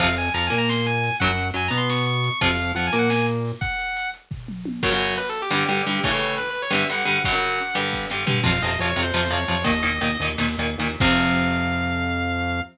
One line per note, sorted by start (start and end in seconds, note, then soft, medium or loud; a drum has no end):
0.00 0.29 F2 loud
0.00 0.07 C3 loud
0.00 0.07 F3 loud
0.00 0.15 F5 medium
0.00 kick medium
0.00 crash medium
0.17 0.32 G#5 medium
0.17 closed hi-hat medium
0.34 0.49 F2 medium
0.34 0.49 F3 medium
0.34 0.45 A#5 medium
0.34 closed hi-hat medium
0.47 1.09 A#3 medium
0.47 0.58 G#5 medium
0.52 1.10 A#2 medium
0.52 closed hi-hat medium
0.58 0.69 A#5 loud
0.69 0.86 C6 loud
0.69 snare medium
0.86 1.15 G#5 loud
0.86 closed hi-hat medium
1.04 open hi-hat medium
1.20 1.51 F#2 medium
1.20 1.28 C#3 loud
1.20 1.28 F#3 loud
1.20 1.47 F#5 medium
1.20 kick medium
1.20 closed hi-hat medium
1.38 closed hi-hat medium
1.54 1.69 F#2 medium
1.54 1.68 F#3 medium
1.54 1.67 G#5 medium
1.54 closed hi-hat medium
1.68 2.30 B2 medium
1.68 2.29 B3 medium
1.68 1.79 A#5 medium
1.73 closed hi-hat medium
1.77 1.88 C6 loud
1.90 2.05 C#6 loud
1.90 snare medium
2.07 2.39 C#6 loud
2.07 closed hi-hat medium
2.24 closed hi-hat medium
2.41 2.72 F2 medium
2.41 2.48 C3 loud
2.41 2.48 F3 loud
2.41 2.71 F5 medium
2.41 kick medium
2.41 closed hi-hat medium
2.59 closed hi-hat soft
2.75 2.89 F2 medium
2.75 2.91 F3 medium
2.75 2.86 F#5 loud
2.75 closed hi-hat medium
2.87 2.97 G#5 medium
2.93 3.52 A#2 medium
2.93 3.51 A#3 medium
2.93 closed hi-hat medium
2.99 3.09 F#5 medium
3.10 3.26 G#5 medium
3.10 snare medium
3.28 closed hi-hat medium
3.45 open hi-hat medium
3.61 4.09 F#5 loud
3.61 kick medium
3.61 closed hi-hat medium
3.79 closed hi-hat medium
3.97 closed hi-hat medium
4.14 closed hi-hat medium
4.31 kick medium
4.31 floor tom medium
4.48 mid tom medium
4.65 high tom medium
4.83 4.90 F#2 medium
4.83 4.90 C#3 medium
4.83 4.90 F#3 medium
4.83 4.98 C#5 loud
4.83 kick medium
4.83 crash medium
4.91 5.18 F#2 medium
4.91 5.18 C#3 medium
4.91 5.18 F#3 medium
4.91 closed hi-hat medium
4.99 5.13 C#5 loud
4.99 closed hi-hat medium
5.08 closed hi-hat medium
5.17 5.28 B4 medium
5.17 closed hi-hat medium
5.26 5.40 A4 loud
5.26 closed hi-hat medium
5.35 closed hi-hat medium
5.42 5.52 G4 loud
5.42 closed hi-hat medium
5.51 5.64 G2 medium
5.51 5.64 D3 medium
5.51 5.64 G3 medium
5.51 5.67 G4 medium
5.51 snare medium
5.61 closed hi-hat medium
5.68 5.82 G2 medium
5.68 5.82 D3 medium
5.68 5.82 G3 medium
5.68 6.01 G4 medium
5.68 closed hi-hat medium
5.78 closed hi-hat medium
5.86 6.00 G2 medium
5.86 6.00 D3 medium
5.86 6.00 G3 medium
5.86 closed hi-hat medium
5.95 closed hi-hat medium
6.03 6.11 A2 medium
6.03 6.11 C#3 medium
6.03 6.11 E3 medium
6.03 6.34 C#5 loud
6.03 kick medium
6.03 closed hi-hat medium
6.11 6.39 A2 medium
6.11 6.39 C#3 medium
6.11 6.39 E3 medium
6.11 closed hi-hat medium
6.21 closed hi-hat medium
6.29 closed hi-hat medium
6.38 6.49 B4 loud
6.38 closed hi-hat medium
6.46 6.61 B4 loud
6.46 closed hi-hat medium
6.55 closed hi-hat medium
6.62 6.73 C#5 loud
6.62 closed hi-hat medium
6.70 6.84 G2 medium
6.70 6.84 D3 medium
6.70 6.84 G3 medium
6.70 6.88 E5 medium
6.70 snare loud
6.81 closed hi-hat medium
6.89 7.03 G2 medium
6.89 7.03 D3 medium
6.89 7.03 G3 medium
6.89 7.23 F#5 loud
6.89 closed hi-hat medium
6.98 closed hi-hat medium
7.05 7.19 G2 medium
7.05 7.19 D3 medium
7.05 7.19 G3 medium
7.05 closed hi-hat medium
7.16 closed hi-hat medium
7.24 7.32 F#2 medium
7.24 7.32 C#3 medium
7.24 7.32 F#3 medium
7.24 7.75 F#5 loud
7.24 kick medium
7.24 closed hi-hat medium
7.32 7.60 F#2 medium
7.32 7.60 C#3 medium
7.32 7.60 F#3 medium
7.32 closed hi-hat medium
7.41 closed hi-hat medium
7.50 closed hi-hat medium
7.59 closed hi-hat medium
7.67 closed hi-hat medium
7.75 8.06 G2 medium
7.75 8.06 D3 medium
7.75 8.06 G3 medium
7.75 closed hi-hat medium
7.84 closed hi-hat medium
7.93 kick medium
7.93 snare medium
8.10 8.25 G2 medium
8.10 8.25 D3 medium
8.10 8.25 G3 medium
8.10 snare medium
8.27 8.40 G2 medium
8.27 8.40 D3 medium
8.27 8.40 G3 medium
8.27 floor tom loud
8.43 8.58 F2 medium
8.43 8.50 C3 medium
8.43 8.50 F3 medium
8.43 8.62 F5 loud
8.43 kick medium
8.43 crash medium
8.62 8.77 F2 medium
8.62 8.71 C3 medium
8.62 8.71 F3 medium
8.62 8.78 D#5 loud
8.62 closed hi-hat medium
8.79 8.94 F2 medium
8.79 8.88 C3 medium
8.79 8.88 F3 medium
8.79 8.90 C#5 loud
8.79 closed hi-hat medium
8.90 9.01 C#5 medium
8.96 9.11 F2 medium
8.96 9.03 C3 medium
8.96 9.03 F3 medium
8.96 closed hi-hat medium
9.02 9.13 C5 medium
9.14 9.28 F2 medium
9.14 9.21 C3 medium
9.14 9.21 F3 medium
9.14 9.32 C5 loud
9.14 snare medium
9.30 9.44 F2 medium
9.30 9.37 C3 medium
9.30 9.37 F3 medium
9.30 9.64 C#5 medium
9.30 closed hi-hat medium
9.48 9.64 F2 medium
9.48 9.55 C3 medium
9.48 9.55 F3 medium
9.48 closed hi-hat medium
9.64 9.82 D#2 medium
9.64 9.71 A#2 loud
9.64 9.71 D#3 loud
9.64 10.25 D#5 loud
9.64 kick medium
9.64 closed hi-hat medium
9.83 9.99 D#2 medium
9.83 9.90 A#2 medium
9.83 9.90 D#3 medium
9.83 closed hi-hat medium
10.01 10.17 D#2 medium
10.01 10.08 A#2 medium
10.01 10.08 D#3 medium
10.01 closed hi-hat medium
10.19 10.36 D#2 medium
10.19 10.29 A#2 medium
10.19 10.29 D#3 medium
10.19 closed hi-hat medium
10.38 10.56 D#2 medium
10.38 10.46 A#2 medium
10.38 10.46 D#3 medium
10.38 snare medium
10.58 10.76 D#2 medium
10.58 10.67 A#2 medium
10.58 10.67 D#3 medium
10.58 closed hi-hat medium
10.78 10.96 D#2 medium
10.78 10.88 A#2 medium
10.78 10.88 D#3 medium
10.78 open hi-hat medium
11.00 12.61 F2 medium
11.00 12.61 C3 loud
11.00 12.61 F3 medium
11.00 12.61 F5 loud
11.00 kick loud
11.00 crash loud